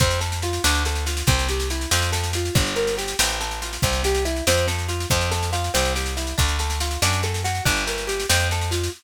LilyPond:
<<
  \new Staff \with { instrumentName = "Acoustic Guitar (steel)" } { \time 6/8 \key f \major \tempo 4. = 94 c'8 a'8 f'8 d'8 a'8 f'8 | c'8 g'8 e'8 c'8 a'8 f'8 | d'8 bes'8 g'8 c'8 a'8 f'8 | c'8 g'8 e'8 c'8 a'8 f'8 |
c'8 a'8 f'8 c'8 g'8 e'8 | d'8 a'8 f'8 d'8 a'8 fis'8 | d'8 bes'8 g'8 c'8 a'8 f'8 | }
  \new Staff \with { instrumentName = "Electric Bass (finger)" } { \clef bass \time 6/8 \key f \major f,4. d,4. | c,4. f,4. | g,,4. a,,4. | c,4. f,4. |
f,4. c,4. | d,4. fis,4. | g,,4. f,4. | }
  \new DrumStaff \with { instrumentName = "Drums" } \drummode { \time 6/8 <bd sn>16 sn16 sn16 sn16 sn16 sn16 sn16 sn16 sn16 sn16 sn16 sn16 | <bd sn>16 sn16 sn16 sn16 sn16 sn16 sn16 sn16 sn16 sn16 sn16 sn16 | <bd sn>16 sn16 sn16 sn16 sn16 sn16 sn16 sn16 sn16 sn16 sn16 sn16 | <bd sn>16 sn16 sn16 sn16 sn16 sn16 sn16 sn16 sn16 sn16 sn16 sn16 |
<bd sn>16 sn16 sn16 sn16 sn16 sn16 sn16 sn16 sn16 sn16 sn16 sn16 | <bd sn>16 sn16 sn16 sn16 sn16 sn16 sn16 sn16 sn16 sn16 sn16 sn16 | <bd sn>16 sn16 sn16 sn16 sn16 sn16 sn16 sn16 sn16 sn16 sn16 sn16 | }
>>